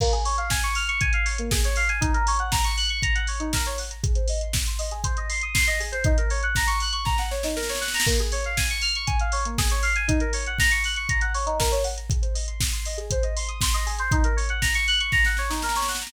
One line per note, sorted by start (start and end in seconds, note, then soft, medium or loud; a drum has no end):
0.00 0.12 A#3 loud
0.00 kick loud
0.00 crash loud
0.13 0.24 G#4 medium
0.13 closed hi-hat medium
0.25 0.37 C#5 medium
0.25 open hi-hat medium
0.38 0.49 F5 medium
0.38 closed hi-hat medium
0.50 0.62 G#5 medium
0.50 kick medium
0.50 snare loud
0.63 0.75 C#6 medium
0.63 closed hi-hat medium
0.75 0.87 F6 medium
0.75 open hi-hat medium
0.88 1.00 C#6 medium
0.88 closed hi-hat medium
1.01 1.12 G#5 medium
1.01 kick loud
1.01 closed hi-hat loud
1.13 1.25 F5 medium
1.13 closed hi-hat medium
1.26 1.37 C#5 medium
1.26 open hi-hat medium
1.38 1.50 A#3 medium
1.38 closed hi-hat medium
1.51 1.63 G#4 medium
1.51 kick loud
1.51 snare loud
1.64 1.76 C#5 medium
1.64 closed hi-hat medium
1.76 1.88 F5 medium
1.76 open hi-hat medium
1.89 2.00 G#5 medium
1.89 closed hi-hat medium
2.01 2.12 D#4 loud
2.01 kick loud
2.01 closed hi-hat loud
2.14 2.25 A#4 medium
2.14 closed hi-hat medium
2.27 2.39 C#5 medium
2.27 open hi-hat loud
2.39 2.51 F#5 medium
2.39 closed hi-hat medium
2.52 2.63 A#5 medium
2.52 kick loud
2.52 snare loud
2.64 2.76 C#6 medium
2.64 closed hi-hat medium
2.77 2.89 F#6 medium
2.77 open hi-hat medium
2.89 3.01 C#6 medium
2.89 closed hi-hat medium
3.02 3.14 A#5 medium
3.02 kick loud
3.02 closed hi-hat loud
3.15 3.26 F#5 medium
3.15 closed hi-hat medium
3.27 3.39 C#5 medium
3.27 open hi-hat medium
3.40 3.51 D#4 medium
3.40 closed hi-hat medium
3.53 3.65 A#4 medium
3.53 kick medium
3.53 snare loud
3.66 3.78 C#5 medium
3.66 closed hi-hat medium
3.78 3.90 F#5 medium
3.78 open hi-hat medium
3.90 4.02 A#5 medium
3.90 closed hi-hat medium
4.03 4.14 G#4 medium
4.03 kick loud
4.03 closed hi-hat loud
4.15 4.27 C5 medium
4.15 closed hi-hat medium
4.28 4.40 D#5 medium
4.28 open hi-hat medium
4.41 4.53 C6 medium
4.41 closed hi-hat medium
4.53 4.65 D#6 medium
4.53 kick loud
4.53 snare loud
4.66 4.78 C6 medium
4.66 closed hi-hat medium
4.79 4.90 D#5 medium
4.79 open hi-hat medium
4.91 5.03 G#4 medium
4.91 closed hi-hat medium
5.04 5.15 C5 medium
5.04 kick loud
5.04 closed hi-hat loud
5.17 5.29 D#5 medium
5.17 closed hi-hat medium
5.29 5.41 C6 medium
5.29 open hi-hat medium
5.41 5.54 D#6 medium
5.41 closed hi-hat medium
5.54 5.65 C6 medium
5.54 kick loud
5.54 snare loud
5.67 5.78 D#5 medium
5.67 closed hi-hat medium
5.80 5.91 G#4 medium
5.80 open hi-hat medium
5.92 6.03 C5 medium
5.92 closed hi-hat medium
6.04 6.16 D#4 loud
6.04 kick loud
6.04 closed hi-hat loud
6.18 6.29 A#4 medium
6.18 closed hi-hat medium
6.30 6.42 C#5 medium
6.30 open hi-hat medium
6.43 6.55 F#5 medium
6.43 closed hi-hat medium
6.55 6.68 A#5 medium
6.55 kick medium
6.55 snare loud
6.67 6.79 C#6 medium
6.67 closed hi-hat medium
6.80 6.93 F#6 medium
6.80 open hi-hat medium
6.93 7.04 C#6 medium
6.93 closed hi-hat medium
7.05 7.17 A#5 medium
7.05 kick loud
7.05 snare medium
7.18 7.30 F#5 medium
7.18 snare medium
7.31 7.42 C#5 medium
7.31 snare medium
7.43 7.55 D#4 medium
7.43 snare medium
7.56 7.68 A#4 medium
7.56 snare medium
7.63 snare medium
7.69 7.81 C#5 medium
7.69 snare medium
7.75 snare medium
7.81 7.92 F#5 medium
7.81 snare medium
7.88 snare medium
7.94 8.05 A#5 medium
7.94 snare medium
8.00 snare loud
8.06 8.18 A#3 loud
8.06 kick loud
8.06 crash loud
8.19 8.31 G#4 medium
8.19 closed hi-hat medium
8.32 8.43 C#5 medium
8.32 open hi-hat medium
8.44 8.57 F5 medium
8.44 closed hi-hat medium
8.57 8.69 G#5 medium
8.57 kick medium
8.57 snare loud
8.70 8.82 C#6 medium
8.70 closed hi-hat medium
8.81 8.93 F6 medium
8.81 open hi-hat medium
8.95 9.07 C#6 medium
8.95 closed hi-hat medium
9.07 9.18 G#5 medium
9.07 kick loud
9.07 closed hi-hat loud
9.20 9.32 F5 medium
9.20 closed hi-hat medium
9.32 9.44 C#5 medium
9.32 open hi-hat medium
9.45 9.57 A#3 medium
9.45 closed hi-hat medium
9.58 9.70 G#4 medium
9.58 kick loud
9.58 snare loud
9.70 9.82 C#5 medium
9.70 closed hi-hat medium
9.83 9.94 F5 medium
9.83 open hi-hat medium
9.96 10.07 G#5 medium
9.96 closed hi-hat medium
10.08 10.19 D#4 loud
10.08 kick loud
10.08 closed hi-hat loud
10.20 10.32 A#4 medium
10.20 closed hi-hat medium
10.33 10.45 C#5 medium
10.33 open hi-hat loud
10.46 10.58 F#5 medium
10.46 closed hi-hat medium
10.59 10.71 A#5 medium
10.59 kick loud
10.59 snare loud
10.71 10.83 C#6 medium
10.71 closed hi-hat medium
10.84 10.96 F#6 medium
10.84 open hi-hat medium
10.96 11.08 C#6 medium
10.96 closed hi-hat medium
11.09 11.21 A#5 medium
11.09 kick loud
11.09 closed hi-hat loud
11.21 11.33 F#5 medium
11.21 closed hi-hat medium
11.34 11.46 C#5 medium
11.34 open hi-hat medium
11.46 11.58 D#4 medium
11.46 closed hi-hat medium
11.60 11.71 A#4 medium
11.60 kick medium
11.60 snare loud
11.72 11.83 C#5 medium
11.72 closed hi-hat medium
11.84 11.95 F#5 medium
11.84 open hi-hat medium
11.97 12.08 A#5 medium
11.97 closed hi-hat medium
12.10 12.22 G#4 medium
12.10 kick loud
12.10 closed hi-hat loud
12.22 12.33 C5 medium
12.22 closed hi-hat medium
12.35 12.46 D#5 medium
12.35 open hi-hat medium
12.47 12.59 C6 medium
12.47 closed hi-hat medium
12.61 12.73 D#6 medium
12.61 kick loud
12.61 snare loud
12.73 12.84 C6 medium
12.73 closed hi-hat medium
12.85 12.97 D#5 medium
12.85 open hi-hat medium
12.97 13.09 G#4 medium
12.97 closed hi-hat medium
13.11 13.23 C5 medium
13.11 kick loud
13.11 closed hi-hat loud
13.23 13.34 D#5 medium
13.23 closed hi-hat medium
13.36 13.48 C6 medium
13.36 open hi-hat medium
13.48 13.60 D#6 medium
13.48 closed hi-hat medium
13.61 13.73 C6 medium
13.61 kick loud
13.61 snare loud
13.74 13.85 D#5 medium
13.74 closed hi-hat medium
13.86 13.98 G#4 medium
13.86 open hi-hat medium
13.99 14.11 C5 medium
13.99 closed hi-hat medium
14.11 14.23 D#4 loud
14.11 kick loud
14.11 closed hi-hat loud
14.24 14.36 A#4 medium
14.24 closed hi-hat medium
14.37 14.48 C#5 medium
14.37 open hi-hat medium
14.49 14.61 F#5 medium
14.49 closed hi-hat medium
14.62 14.73 A#5 medium
14.62 kick medium
14.62 snare loud
14.74 14.86 C#6 medium
14.74 closed hi-hat medium
14.88 14.99 F#6 medium
14.88 open hi-hat medium
15.00 15.11 C#6 medium
15.00 closed hi-hat medium
15.12 15.24 A#5 medium
15.12 kick loud
15.12 snare medium
15.24 15.37 F#5 medium
15.24 snare medium
15.37 15.50 C#5 medium
15.37 snare medium
15.50 15.61 D#4 medium
15.50 snare medium
15.62 15.74 A#4 medium
15.62 snare medium
15.69 snare medium
15.76 15.87 C#5 medium
15.76 snare medium
15.82 snare medium
15.88 16.00 F#5 medium
15.88 snare medium
15.95 snare medium
16.01 16.12 A#5 medium
16.01 snare medium
16.07 snare loud